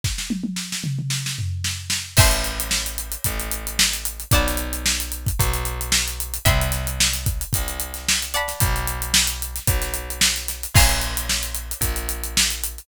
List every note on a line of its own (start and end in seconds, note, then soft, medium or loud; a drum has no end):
0.04 kick medium
0.04 snare medium
0.18 snare medium
0.30 high tom medium
0.43 high tom medium
0.56 snare medium
0.72 snare medium
0.84 mid tom medium
0.99 mid tom medium
1.10 snare medium
1.26 snare medium
1.39 floor tom medium
1.64 snare medium
1.90 snare medium
2.17 3.17 A1 medium
2.17 4.28 E5 medium
2.17 4.28 G5 medium
2.17 4.28 A5 medium
2.17 4.28 C6 medium
2.17 kick loud
2.17 crash loud
2.31 closed hi-hat medium
2.44 closed hi-hat medium
2.60 closed hi-hat medium
2.71 snare medium
2.86 closed hi-hat medium
2.98 closed hi-hat medium
3.12 closed hi-hat medium
3.24 4.25 A1 medium
3.24 kick medium
3.24 closed hi-hat loud
3.40 closed hi-hat medium
3.51 closed hi-hat medium
3.67 closed hi-hat medium
3.79 snare loud
3.93 closed hi-hat medium
4.05 closed hi-hat medium
4.20 closed hi-hat medium
4.31 5.31 B1 loud
4.31 6.43 D5 medium
4.31 6.43 F#5 medium
4.31 6.43 A5 medium
4.31 kick loud
4.31 closed hi-hat loud
4.35 6.43 B5 medium
4.47 snare soft
4.47 closed hi-hat medium
4.57 closed hi-hat medium
4.73 closed hi-hat medium
4.86 snare loud
5.00 closed hi-hat medium
5.12 closed hi-hat medium
5.26 kick medium
5.26 closed hi-hat medium
5.39 6.39 B1 medium
5.39 kick medium
5.39 closed hi-hat loud
5.53 closed hi-hat medium
5.65 closed hi-hat medium
5.81 closed hi-hat medium
5.92 snare loud
6.08 closed hi-hat medium
6.20 closed hi-hat medium
6.34 closed hi-hat medium
6.45 7.45 C2 loud
6.45 8.24 E5 medium
6.45 8.24 G5 medium
6.45 8.24 B5 medium
6.45 8.24 C6 medium
6.45 kick loud
6.45 closed hi-hat medium
6.61 closed hi-hat medium
6.72 snare soft
6.72 closed hi-hat medium
6.87 closed hi-hat medium
7.00 snare loud
7.14 snare soft
7.14 closed hi-hat medium
7.26 kick medium
7.26 closed hi-hat medium
7.41 closed hi-hat medium
7.53 8.54 C2 medium
7.53 kick medium
7.53 closed hi-hat loud
7.68 closed hi-hat medium
7.80 closed hi-hat medium
7.94 snare soft
7.94 closed hi-hat medium
8.08 snare loud
8.22 closed hi-hat medium
8.34 10.71 D5 medium
8.34 10.71 F#5 medium
8.34 10.71 A5 medium
8.34 10.71 B5 medium
8.34 closed hi-hat medium
8.48 snare soft
8.48 closed hi-hat medium
8.60 9.60 B1 loud
8.60 kick loud
8.60 closed hi-hat loud
8.76 closed hi-hat medium
8.87 closed hi-hat medium
9.02 closed hi-hat medium
9.14 snare loud
9.27 closed hi-hat medium
9.42 closed hi-hat medium
9.56 snare soft
9.56 closed hi-hat medium
9.67 10.67 B1 medium
9.67 kick medium
9.67 closed hi-hat loud
9.82 snare soft
9.82 closed hi-hat medium
9.94 closed hi-hat medium
10.10 closed hi-hat medium
10.21 snare loud
10.36 snare soft
10.36 closed hi-hat medium
10.48 snare soft
10.48 closed hi-hat medium
10.63 closed hi-hat medium
10.74 11.74 A#1 medium
10.74 12.86 F5 medium
10.74 12.86 G#5 medium
10.74 12.86 A#5 medium
10.74 12.86 C#6 medium
10.74 kick loud
10.74 crash loud
10.89 closed hi-hat medium
11.01 closed hi-hat medium
11.17 closed hi-hat medium
11.29 snare medium
11.43 closed hi-hat medium
11.55 closed hi-hat medium
11.71 closed hi-hat medium
11.81 12.80 A#1 medium
11.81 kick medium
11.81 closed hi-hat loud
11.96 closed hi-hat medium
12.09 closed hi-hat medium
12.24 closed hi-hat medium
12.37 snare loud
12.50 closed hi-hat medium
12.64 closed hi-hat medium
12.78 closed hi-hat medium